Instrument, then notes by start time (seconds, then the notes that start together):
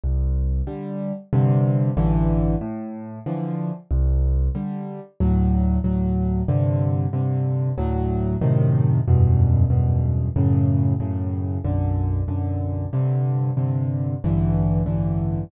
acoustic grand piano
0.04 C2
0.67 D3 G3
1.33 G2 C3 D3
1.97 A1 G2 D3 E3
2.61 A2
3.26 D3 E3 F3
3.91 C2
4.55 D3 G3
5.20 D2 A2 F#3
5.84 D2 A2 F#3
6.48 G2 C3 D3
7.13 G2 C3 D3
7.78 D2 A2 F#3
8.41 F#2 A2 C3 D#3
9.08 E2 F#2 G2 B2
9.70 E2 F#2 G2 B2
10.36 F#2 A2 C#3
11.00 F#2 A2 C#3
11.65 B1 F#2 D3
12.28 B1 F#2 D3
12.93 G2 C3 D3
13.57 G2 C3 D3
14.24 A1 G2 D3 E3
14.86 A1 G2 D3 E3